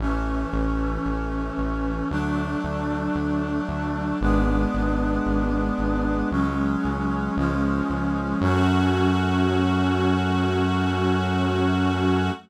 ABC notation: X:1
M:4/4
L:1/8
Q:1/4=57
K:F#m
V:1 name="String Ensemble 1"
z8 | z8 | F8 |]
V:2 name="Brass Section"
[E,A,C]4 [F,A,D]4 | [G,B,D]4 [F,G,C]2 [^E,G,C]2 | [F,A,C]8 |]
V:3 name="Synth Bass 1" clef=bass
A,,, A,,, A,,, A,,, D,, D,, D,, D,, | G,,, G,,, G,,, G,,, C,, C,, C,, C,, | F,,8 |]